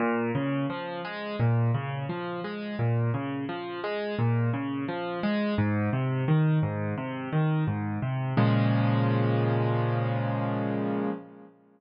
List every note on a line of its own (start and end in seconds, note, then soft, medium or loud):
0.00 0.31 A#2 loud
0.35 0.66 C#3 loud
0.70 1.01 F3 medium
1.05 1.36 G#3 loud
1.40 1.71 A#2 loud
1.74 2.06 C#3 loud
2.09 2.41 F3 medium
2.44 2.76 G#3 medium
2.79 3.10 A#2 medium
3.14 3.45 C#3 medium
3.49 3.80 F3 medium
3.84 4.15 G#3 loud
4.19 4.50 A#2 loud
4.53 4.85 C#3 medium
4.88 5.20 F3 medium
5.23 5.55 G#3 loud
5.58 5.90 G#2 loud
5.93 6.24 C3 medium
6.28 6.59 D#3 loud
6.63 6.94 G#2 loud
6.98 7.29 C3 medium
7.33 7.64 D#3 medium
7.67 7.99 G#2 medium
8.02 8.34 C3 medium
8.37 11.10 A#2 loud
8.37 11.10 C#3 loud
8.37 11.10 F3 loud
8.37 11.10 G#3 loud